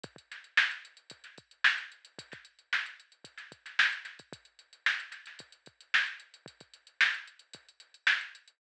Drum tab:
HH |xxxx-xxxxxxx-xxx|xxxx-xxxxxxx-xxx|xxxx-xxxxxxx-xxx|xxxx-xxxxxxx-xxx|
SD |--o-o----o--o---|-o--o----o-oo-o-|----o-oo----o---|----o-------o---|
BD |oo------o-o-----|oo------o-o----o|o-------o-o-----|oo------o-------|